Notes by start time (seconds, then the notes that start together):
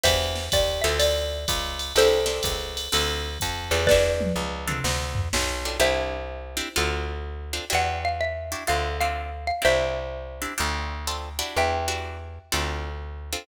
0.04 E2 D4 E4 F#4 G4 C5 E5, kick, ride
0.35 snare
0.52 D#2 D5, kick, hi-hat pedal, ride
0.82 D2 C4 D4 F4 A4 E5, ride
0.99 D5, ride
1.48 C#2, kick, hi-hat pedal, ride
1.79 ride
1.96 C2 C4 D4 E4 G4 A4 C5, ride
2.26 C4 D4 E4 G4, snare
2.43 C#2, kick, hi-hat pedal, ride
2.77 ride
2.92 D2 C4 D4 F4 A4, ride
3.40 F2, kick, hi-hat pedal, ride
3.71 E2 C4 D4 F4 A4, ride
3.87 B4 D5, kick, snare
3.91 D4 E4 F#4 G4
4.21 high tom
4.36 C#2
4.67 C4 D4 F4 A4, mid tom
4.84 D2, snare
5.15 floor tom
5.33 B1, snare
5.65 C4 D4 F4 A4
5.80 C2 C4 D4 E4 G4 C5 E5
6.57 C4 D4 E4 G4
6.76 D2 C4 D4 F4 A4
7.53 C4 D4 F4 A4
7.70 E2 D4 E4 F#4 G4
7.75 F#5
8.05 F5
8.21 E5
8.52 D4 E4 F#4 G4
8.67 D2 C4 D4 F4 A4 F5
9.01 C4 D4 F4 A4 F5
9.47 F5
9.62 C2 C4 D4 E4 G4 C5 E5
10.42 C4 D4 E4 G4
10.58 D2 C4 D4 F4 A4
11.07 C4 D4 F4 A4
11.39 D4 E4 F#4 G4
11.56 E2 E5 G5
11.88 D4 E4 F#4 G4
12.52 D2 C4 D4 F4 A4
13.33 C4 D4 F4 A4